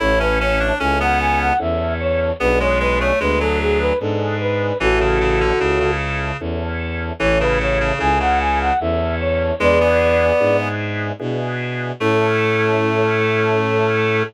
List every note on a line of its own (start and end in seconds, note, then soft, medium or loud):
0.00 0.72 A1 loud
0.00 0.72 C#4 medium
0.00 0.19 E4 loud
0.00 0.72 E4 medium
0.00 0.72 A4 medium
0.00 0.19 C#5 medium
0.20 0.39 C#4 loud
0.20 0.39 B4 medium
0.40 0.59 C#4 loud
0.40 0.75 C#5 medium
0.60 0.79 D4 loud
0.80 1.52 C#2 loud
0.80 0.99 C#4 loud
0.80 1.53 C#4 medium
0.80 1.53 E4 medium
0.80 1.53 A4 medium
0.80 0.99 G#5 medium
1.00 1.53 B3 loud
1.00 1.19 F#5 medium
1.20 1.39 G#5 medium
1.40 1.59 F#5 medium
1.59 2.32 E2 medium
1.59 2.31 C#4 medium
1.59 2.31 E4 medium
1.59 2.31 A4 medium
1.59 1.94 E5 medium
2.00 2.33 C#5 medium
2.40 3.12 B1 loud
2.40 2.59 B3 loud
2.40 3.12 B3 medium
2.40 3.12 D4 medium
2.40 3.12 G#4 medium
2.40 2.59 B4 loud
2.60 2.79 G#3 loud
2.60 2.79 C#5 medium
2.80 2.99 G#3 loud
2.80 2.99 B4 medium
3.00 3.19 A3 loud
3.00 3.19 C#5 medium
3.20 3.92 D2 loud
3.20 3.39 G#3 loud
3.20 3.93 B3 medium
3.20 3.93 D4 medium
3.20 3.93 G#4 medium
3.20 3.39 B4 medium
3.40 3.93 F#3 loud
3.40 3.59 A4 medium
3.60 3.79 G#4 medium
3.80 3.99 B4 medium
4.00 4.72 G#2 loud
4.00 4.73 B3 medium
4.00 4.73 D4 medium
4.00 4.73 G#4 medium
4.00 4.37 A4 medium
4.40 4.78 B4 medium
4.80 5.52 A1 loud
4.80 4.99 E3 loud
4.80 5.52 C#4 medium
4.80 5.52 E4 medium
4.80 5.91 F#4 medium
4.80 5.91 A4 medium
4.80 5.52 A4 medium
5.00 5.19 C#3 loud
5.21 5.40 C#3 loud
5.40 5.59 D3 loud
5.59 6.32 C#2 medium
5.59 5.79 C#3 loud
5.59 6.31 C#4 medium
5.59 6.31 E4 medium
5.59 6.31 A4 medium
5.80 6.37 C#3 loud
6.40 7.12 E2 medium
6.40 7.13 C#4 medium
6.40 7.13 E4 medium
6.40 7.13 A4 medium
7.20 7.92 A1 loud
7.20 7.39 E3 loud
7.20 7.92 C#4 medium
7.20 7.92 E4 medium
7.20 7.92 A4 medium
7.20 7.39 C#5 medium
7.40 7.59 C#3 loud
7.40 7.59 B4 medium
7.60 7.79 C#3 medium
7.60 7.94 C#5 medium
7.80 7.99 C#3 loud
7.99 8.72 C#2 loud
7.99 8.19 C#3 loud
7.99 8.71 C#4 medium
7.99 8.71 E4 medium
7.99 8.71 A4 medium
7.99 8.19 G#5 medium
8.20 8.73 C#3 loud
8.20 8.39 F#5 medium
8.40 8.59 G#5 medium
8.60 8.79 F#5 medium
8.80 9.52 E2 loud
8.80 9.54 C#4 medium
8.80 9.54 E4 medium
8.80 9.54 A4 medium
8.80 9.15 E5 medium
9.20 9.55 C#5 medium
9.60 10.32 E2 loud
9.60 9.79 G#3 loud
9.60 10.32 B3 medium
9.60 10.32 D4 medium
9.60 10.32 E4 medium
9.60 10.32 G#4 medium
9.60 10.57 B4 medium
9.60 10.57 D5 medium
9.81 10.68 B3 loud
10.40 11.12 G#2 medium
10.40 11.12 B3 medium
10.40 11.12 D4 medium
10.40 11.12 E4 medium
10.40 11.12 G#4 medium
11.20 11.92 B2 medium
11.20 11.92 B3 medium
11.20 11.92 D4 medium
11.20 11.92 E4 medium
11.20 11.92 G#4 medium
12.00 14.23 A2 loud
12.00 14.23 A3 loud
12.00 14.24 C#4 loud
12.00 14.24 E4 medium
12.00 14.23 A4 loud
12.00 14.24 A4 loud